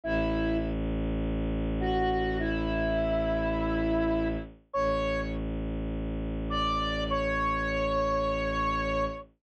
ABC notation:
X:1
M:4/4
L:1/8
Q:1/4=51
K:Amix
V:1 name="Flute"
[Ee] z2 [Ff] [Ee]4 | [cc'] z2 [dd'] [cc']4 |]
V:2 name="Violin" clef=bass
A,,,8 | A,,,8 |]